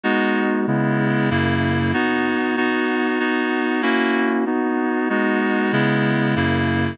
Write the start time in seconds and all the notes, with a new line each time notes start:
0.04 G#3 B3 D#4 F#4
0.67 C#3 G#3 B3 E4
1.30 F#2 C#3 A#3 E4
1.93 B3 D#4 F#4
2.57 B3 D#4 F#4
3.19 B3 D#4 F#4
3.82 A#3 C#4 E4 F#4
4.46 B3 D#4 F#4
5.09 G#3 B3 D#4 F#4
5.72 C#3 G#3 B3 E4
6.36 F#2 C#3 A#3 E4